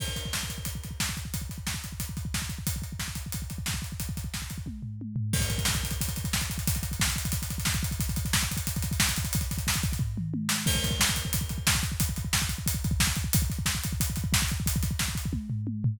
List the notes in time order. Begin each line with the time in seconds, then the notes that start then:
0.00 kick, crash
0.08 kick
0.16 kick, closed hi-hat
0.25 kick
0.33 kick, snare
0.43 kick
0.50 kick, closed hi-hat
0.58 kick
0.65 kick, closed hi-hat
0.75 kick
0.84 kick, closed hi-hat
0.91 kick
1.00 kick, snare
1.09 kick
1.17 kick, closed hi-hat
1.25 kick
1.34 kick, closed hi-hat
1.42 kick
1.49 kick, closed hi-hat
1.58 kick
1.67 kick, snare
1.74 kick
1.84 kick, closed hi-hat
1.92 kick
2.00 kick, closed hi-hat
2.09 kick
2.17 kick, closed hi-hat
2.25 kick
2.34 kick, snare
2.42 kick
2.49 kick, closed hi-hat
2.58 kick
2.67 kick, closed hi-hat
2.76 kick
2.82 kick, closed hi-hat
2.92 kick
2.99 kick, snare
3.08 kick
3.15 kick, closed hi-hat
3.26 kick
3.32 kick, closed hi-hat
3.42 kick
3.50 kick, closed hi-hat
3.58 kick
3.66 kick, snare
3.74 kick
3.82 kick, closed hi-hat
3.92 kick
4.00 kick, closed hi-hat
4.09 kick
4.17 kick, closed hi-hat
4.24 kick
4.34 kick, snare
4.42 kick
4.50 kick, closed hi-hat
4.58 kick
4.66 kick, high tom
4.82 floor tom
5.01 high tom
5.16 floor tom
5.33 kick, crash
5.40 kick, closed hi-hat
5.50 kick, closed hi-hat
5.58 kick, closed hi-hat
5.65 kick, snare
5.74 kick, closed hi-hat
5.83 kick, closed hi-hat
5.91 kick, closed hi-hat
6.01 kick, closed hi-hat
6.08 kick, closed hi-hat
6.16 kick, closed hi-hat
6.24 kick, closed hi-hat
6.33 kick, snare
6.41 kick, closed hi-hat
6.50 kick, closed hi-hat
6.58 kick, closed hi-hat
6.67 kick, closed hi-hat
6.75 kick, closed hi-hat
6.83 kick, closed hi-hat
6.91 kick, closed hi-hat
7.00 kick, snare
7.08 kick, closed hi-hat
7.16 kick, closed hi-hat
7.25 kick, closed hi-hat
7.32 kick, closed hi-hat
7.42 kick, closed hi-hat
7.50 kick, closed hi-hat
7.58 kick, closed hi-hat
7.65 kick, snare
7.74 kick, closed hi-hat
7.83 kick, closed hi-hat
7.91 kick, closed hi-hat
8.00 kick, closed hi-hat
8.09 kick, closed hi-hat
8.16 kick, closed hi-hat
8.25 kick, closed hi-hat
8.33 kick, snare
8.41 kick, closed hi-hat
8.51 kick, closed hi-hat
8.57 kick, closed hi-hat
8.67 kick, closed hi-hat
8.76 kick, closed hi-hat
8.82 kick, closed hi-hat
8.91 kick, closed hi-hat
9.00 kick, snare
9.09 kick, closed hi-hat
9.16 kick, closed hi-hat
9.25 kick, closed hi-hat
9.33 kick, closed hi-hat
9.41 kick, closed hi-hat
9.51 kick, closed hi-hat
9.58 kick, closed hi-hat
9.67 kick, snare
9.74 kick, closed hi-hat
9.83 kick, closed hi-hat
9.92 kick, closed hi-hat
9.99 kick, floor tom
10.17 mid tom
10.34 high tom
10.49 snare
10.66 kick, crash
10.75 kick
10.84 kick, closed hi-hat
10.91 kick
11.00 kick, snare
11.09 kick
11.16 kick, closed hi-hat
11.25 kick
11.33 kick, closed hi-hat
11.41 kick
11.49 kick, closed hi-hat
11.58 kick
11.67 kick, snare
11.75 kick
11.83 kick, closed hi-hat
11.92 kick
12.00 kick, closed hi-hat
12.09 kick
12.16 kick, closed hi-hat
12.25 kick
12.33 kick, snare
12.42 kick
12.49 kick, closed hi-hat
12.58 kick
12.66 kick, closed hi-hat
12.74 kick
12.84 kick, closed hi-hat
12.91 kick
13.00 kick, snare
13.07 kick
13.16 kick, closed hi-hat
13.24 kick
13.33 kick, closed hi-hat
13.42 kick
13.50 kick, closed hi-hat
13.59 kick
13.66 kick, snare
13.75 kick
13.84 kick, closed hi-hat
13.93 kick
14.00 kick, closed hi-hat
14.10 kick
14.16 kick, closed hi-hat
14.24 kick
14.33 kick, snare
14.42 kick
14.48 kick, closed hi-hat
14.60 kick
14.66 kick, closed hi-hat
14.76 kick
14.83 kick, closed hi-hat
14.91 kick
14.99 kick, snare
15.08 kick
15.15 kick, closed hi-hat
15.25 kick
15.33 kick, high tom
15.50 floor tom
15.67 high tom
15.84 floor tom